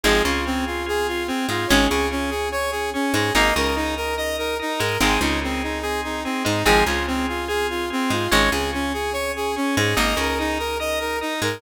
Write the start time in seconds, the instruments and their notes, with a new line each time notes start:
0.04 electric bass (finger) G#1, acoustic guitar (steel) F3 G#3 C4, drawbar organ C4 F4 G#4, lead 2 (sawtooth) G#4
0.25 electric bass (finger) C#2, acoustic guitar (steel) C#3, lead 2 (sawtooth) F4
0.46 drawbar organ C4 F4 G#4, lead 2 (sawtooth) C4
0.67 lead 2 (sawtooth) F4
0.86 drawbar organ C4 F4 G#4, lead 2 (sawtooth) G#4
1.08 lead 2 (sawtooth) F4
1.27 lead 2 (sawtooth) C4, drawbar organ C4 F4 G#4
1.49 electric bass (finger) G#2, acoustic guitar (steel) G#3, lead 2 (sawtooth) F4
1.67 electric bass (finger) G#1, drawbar organ C#4 G#4, acoustic guitar (steel) C#4, lead 2 (sawtooth) C#5
1.72 acoustic guitar (steel) G#3
1.89 electric bass (finger) C#2, acoustic guitar (steel) C#3, lead 2 (sawtooth) G#4
2.11 drawbar organ C#4 G#4, lead 2 (sawtooth) C#4
2.30 lead 2 (sawtooth) G#4
2.52 drawbar organ C#4 G#4, lead 2 (sawtooth) C#5
2.71 lead 2 (sawtooth) G#4
2.94 drawbar organ C#4 G#4, lead 2 (sawtooth) C#4
3.14 electric bass (finger) G#2, acoustic guitar (steel) G#3, lead 2 (sawtooth) G#4
3.34 electric bass (finger) G#1, acoustic guitar (steel) A#3 D#4, drawbar organ D#4 A#4, lead 2 (sawtooth) D#5
3.56 electric bass (finger) C#2, acoustic guitar (steel) C#3, lead 2 (sawtooth) A#4
3.76 lead 2 (sawtooth) D#4, drawbar organ D#4 A#4
3.96 lead 2 (sawtooth) A#4
4.17 drawbar organ D#4 A#4, lead 2 (sawtooth) D#5
4.38 lead 2 (sawtooth) A#4
4.59 drawbar organ D#4 A#4, lead 2 (sawtooth) D#4
4.79 electric bass (finger) G#2, acoustic guitar (steel) G#3, lead 2 (sawtooth) A#4
5.00 electric bass (finger) G#1, acoustic guitar (steel) D#3 G#3 C4, drawbar organ C4 D#4 G#4, lead 2 (sawtooth) G#4
5.21 electric bass (finger) C#2, acoustic guitar (steel) C#3, lead 2 (sawtooth) D#4
5.41 drawbar organ C4 D#4 G#4, lead 2 (sawtooth) C4
5.63 lead 2 (sawtooth) D#4
5.82 drawbar organ C4 D#4 G#4, lead 2 (sawtooth) G#4
6.04 lead 2 (sawtooth) D#4
6.24 lead 2 (sawtooth) C4, drawbar organ C4 D#4 G#4
6.45 electric bass (finger) G#2, acoustic guitar (steel) G#3, lead 2 (sawtooth) D#4
6.65 electric bass (finger) G#1, acoustic guitar (steel) F3 G#3 C4, drawbar organ C4 F4 G#4, lead 2 (sawtooth) G#4
6.86 electric bass (finger) C#2, acoustic guitar (steel) C#3, lead 2 (sawtooth) F4
7.07 lead 2 (sawtooth) C4, drawbar organ C4 F4 G#4
7.29 lead 2 (sawtooth) F4
7.48 drawbar organ C4 F4 G#4, lead 2 (sawtooth) G#4
7.70 lead 2 (sawtooth) F4
7.90 drawbar organ C4 F4 G#4, lead 2 (sawtooth) C4
8.10 electric bass (finger) G#2, acoustic guitar (steel) G#3, lead 2 (sawtooth) F4
8.31 electric bass (finger) G#1, acoustic guitar (steel) G#3 C#4, drawbar organ C#4 G#4, lead 2 (sawtooth) C#5
8.52 electric bass (finger) C#2, acoustic guitar (steel) C#3, lead 2 (sawtooth) G#4
8.73 drawbar organ C#4 G#4, lead 2 (sawtooth) C#4
8.93 lead 2 (sawtooth) G#4
9.13 drawbar organ C#4 G#4, lead 2 (sawtooth) C#5
9.36 lead 2 (sawtooth) G#4
9.56 drawbar organ C#4 G#4, lead 2 (sawtooth) C#4
9.77 electric bass (finger) G#2, acoustic guitar (steel) G#3, lead 2 (sawtooth) G#4
9.97 electric bass (finger) G#1, acoustic guitar (steel) A#3 D#4, drawbar organ D#4 A#4, lead 2 (sawtooth) D#5
10.16 electric bass (finger) C#2, acoustic guitar (steel) C#3, lead 2 (sawtooth) A#4
10.39 drawbar organ D#4 A#4, lead 2 (sawtooth) D#4
10.59 lead 2 (sawtooth) A#4
10.80 drawbar organ D#4 A#4, lead 2 (sawtooth) D#5
11.00 lead 2 (sawtooth) A#4
11.21 drawbar organ D#4 A#4, lead 2 (sawtooth) D#4
11.42 electric bass (finger) G#2, acoustic guitar (steel) G#3, lead 2 (sawtooth) A#4